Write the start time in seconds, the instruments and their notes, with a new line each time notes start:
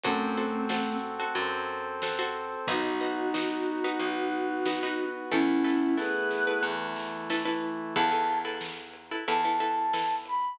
0.04 electric bass (finger) F#2, choir aahs A3 C4, brass section C4 F#4 A4, pizzicato strings F#4 A4 C5, kick, closed hi-hat
0.37 pizzicato strings F#4 A4 C5
0.69 pizzicato strings F#4 A4 C5, snare
1.20 pizzicato strings F#4 A4 C5
1.35 electric bass (finger) F#2, brass section C4 A4 C5, closed hi-hat
2.02 pizzicato strings F#4 A4 C5, snare
2.19 pizzicato strings F#4 A4 C5
2.67 electric bass (finger) B1, brass section B3 D#4 F#4, pizzicato strings D#4 F#4 B4, choir aahs D#4 F#4, kick, closed hi-hat
3.01 pizzicato strings D#4 F#4 B4
3.34 pizzicato strings D#4 F#4 B4, snare
3.84 pizzicato strings D#4 F#4 B4
3.99 electric bass (finger) B1, brass section B3 F#4 B4, closed hi-hat
4.66 pizzicato strings D#4 F#4 B4, snare
4.83 pizzicato strings D#4 F#4 B4
5.31 electric bass (finger) E2, brass section A3 B3 E4, choir aahs C#4 E4, pizzicato strings E4 A4 B4, kick, snare
5.64 pizzicato strings E4 A4 B4, snare
5.98 pizzicato strings E4 A4 B4, choir aahs G#4 B4, snare
6.31 snare
6.47 pizzicato strings E4 A4 B4
6.63 electric bass (finger) E2, brass section E3 A3 E4
6.96 snare
7.30 pizzicato strings E4 A4 B4, snare
7.45 pizzicato strings E4 A4 B4
7.96 electric bass (finger) E2, pizzicato strings E4 A4 B4, flute A5, kick, crash
8.11 pizzicato strings E4 A4 B4
8.28 closed hi-hat
8.45 pizzicato strings E4 A4 B4
8.61 snare
8.94 closed hi-hat
9.11 pizzicato strings E4 A4 B4
9.28 electric bass (finger) E2, pizzicato strings E4 A4 B4, flute A5, closed hi-hat
9.45 pizzicato strings E4 A4 B4
9.60 pizzicato strings E4 A4 B4, closed hi-hat
9.93 pizzicato strings E4 A4 B4, snare
10.26 flute B5, closed hi-hat